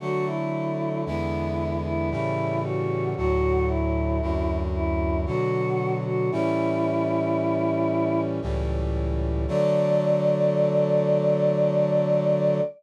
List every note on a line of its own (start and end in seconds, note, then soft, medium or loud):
0.00 1.04 D3 medium
0.00 1.04 F#3 medium
0.00 1.04 A3 medium
0.00 0.25 F#4 loud
0.26 1.00 E4 medium
1.05 2.10 E2 medium
1.05 2.10 D3 medium
1.05 2.10 G#3 medium
1.05 2.10 B3 medium
1.05 1.77 E4 medium
1.84 2.09 E4 loud
2.10 3.15 A2 medium
2.10 3.15 C#3 medium
2.10 3.15 E3 medium
2.10 3.15 G3 medium
2.10 2.59 E4 loud
2.64 3.10 F#4 medium
3.16 4.21 D2 medium
3.16 4.21 A2 medium
3.16 4.21 F#3 medium
3.16 3.66 F#4 loud
3.68 4.57 E4 medium
4.21 5.26 D2 medium
4.21 5.26 F#2 medium
4.21 5.25 F#3 medium
4.74 5.20 E4 medium
5.26 6.30 B2 medium
5.26 6.30 D3 medium
5.26 6.30 F#3 medium
5.26 5.93 F#4 loud
6.05 6.30 F#4 medium
6.31 8.40 A2 medium
6.31 8.40 E3 medium
6.31 8.40 G3 medium
6.31 8.40 C#4 medium
6.31 8.20 E4 loud
8.42 9.46 C#2 medium
8.42 9.46 A2 medium
8.42 9.46 E3 medium
8.42 9.46 G3 medium
9.47 12.60 D3 medium
9.47 12.60 F#3 loud
9.47 12.60 A3 loud
9.47 12.60 D5 loud